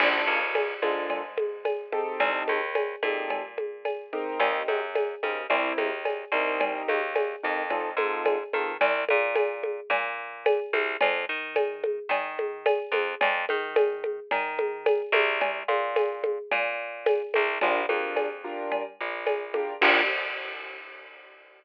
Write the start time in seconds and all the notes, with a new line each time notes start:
0.00 A#1 A#3 D4 F4 A4, crash, cowbell, low conga
0.27 C#2
0.55 tambourine, cowbell, high conga
0.82 G#2 A#3 D4 F4 A4, high conga
1.10 cowbell, low conga
1.38 high conga
1.65 tambourine, cowbell, high conga
1.92 C4 D#4 G4 A4, high conga
2.20 C2, cowbell, low conga
2.48 D#2, high conga
2.75 tambourine, cowbell, high conga
3.03 A#2 C4 D#4 G4 A4, high conga
3.30 cowbell, low conga
3.58 high conga
3.85 tambourine, cowbell, high conga
4.13 C4 D#4 G4 A#4, high conga
4.40 D#2, cowbell, low conga
4.68 F#2, high conga
4.95 tambourine, cowbell, high conga
5.23 C#3 C4 D#4 G4 A#4, high conga
5.50 C2 C4 E4 G4 A#4, cowbell, low conga
5.78 D#2, high conga
6.05 tambourine, cowbell, high conga
6.32 C2 C4 D#4 G4 A#4
6.60 cowbell, low conga
6.88 D#2, high conga
7.16 tambourine, cowbell, high conga
7.43 F2 C4 D#4 G4 A#4
7.70 C4 D#4 F4 A4, cowbell, low conga
7.97 G#2 C4 D#4 F4 A4, high conga
8.25 tambourine, cowbell, high conga
8.53 D#3 C4 D#4 F4 A4, high conga
8.81 C2, cowbell, low conga
9.09 A#2, high conga
9.35 tambourine, cowbell, high conga
9.63 high conga
9.90 A#2, cowbell, low conga
10.46 tambourine, cowbell, high conga
10.73 C2, high conga
11.01 F2, cowbell, low conga
11.29 D#3
11.56 tambourine, cowbell, high conga
11.84 high conga
12.09 D#3, cowbell, low conga
12.39 high conga
12.66 tambourine, cowbell, high conga
12.92 F2, high conga
13.21 F2, cowbell, low conga
13.49 D#3, high conga
13.76 tambourine, cowbell, high conga
14.04 high conga
14.31 D#3, cowbell, low conga
14.59 high conga
14.86 tambourine, cowbell, high conga
15.12 C2, high conga
15.41 cowbell, low conga
15.68 A#2, high conga
15.96 tambourine, cowbell, high conga
16.24 high conga
16.51 A#2, cowbell, low conga
17.06 tambourine, cowbell, high conga
17.34 C2, high conga
17.61 A#1 D4 F4 G4 A#4, cowbell, low conga
17.89 F2 D4 F4 G4 A#4, high conga
18.16 tambourine, cowbell, high conga
18.44 D4 F4 G4 A#4
18.72 cowbell, low conga
19.01 A#1
19.26 tambourine, cowbell, high conga
19.54 D4 F4 G4 A#4, high conga
19.82 A#1 A#3 D4 F4 G4, kick, crash